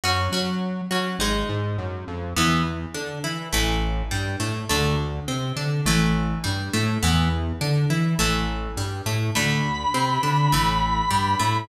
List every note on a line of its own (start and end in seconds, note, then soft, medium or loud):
0.04 0.28 F#2 loud
0.04 0.30 C#4 loud
0.04 0.30 F#4 medium
0.32 0.81 F#3 medium
0.32 0.86 C#4 medium
0.32 0.86 F#4 medium
0.91 1.16 F#3 medium
0.91 1.18 C#4 medium
0.91 1.18 F#4 medium
1.19 1.44 G#1 loud
1.19 2.27 G#3 loud
1.19 2.27 D#4 loud
1.49 1.77 G#2 loud
1.78 2.04 F#2 medium
2.08 2.34 F2 loud
2.36 2.86 E2 loud
2.36 2.63 E3 loud
2.36 2.63 B3 loud
2.94 3.19 D3 medium
2.94 3.19 D4 medium
3.24 3.49 E3 medium
3.24 3.49 E4 medium
3.53 4.03 A1 loud
3.53 4.05 E3 loud
3.53 4.05 A3 loud
4.11 4.36 G2 medium
4.11 4.36 G3 medium
4.40 4.65 A2 medium
4.40 4.65 A3 medium
4.69 5.20 D2 loud
4.69 4.96 D3 loud
4.69 4.96 A3 loud
5.28 5.52 C3 medium
5.28 5.53 C4 medium
5.56 5.81 D3 medium
5.56 5.81 D4 medium
5.85 6.35 A1 loud
5.85 6.39 E3 loud
5.85 6.39 A3 loud
6.44 6.70 G2 medium
6.44 6.69 G3 medium
6.73 6.99 A2 loud
6.73 6.98 A3 loud
7.03 7.53 E2 loud
7.03 7.29 E3 loud
7.03 7.29 B3 loud
7.61 7.86 D3 loud
7.61 7.86 D4 medium
7.90 8.15 E3 medium
7.90 8.15 E4 medium
8.19 8.68 A1 loud
8.19 8.71 E3 loud
8.19 8.71 A3 loud
8.77 9.02 G2 medium
8.77 9.02 G3 medium
9.06 9.31 A2 medium
9.06 9.31 A3 medium
9.35 9.85 D2 loud
9.35 9.61 D3 loud
9.35 9.61 A3 loud
9.35 11.57 B5 medium
9.94 10.19 C3 loud
9.94 10.19 C4 medium
10.23 10.48 D3 medium
10.23 10.48 D4 medium
10.52 11.02 A1 loud
10.52 11.05 E3 loud
10.52 11.05 A3 loud
11.10 11.35 G2 loud
11.10 11.35 G3 medium
11.39 11.65 A2 loud
11.39 11.64 A3 medium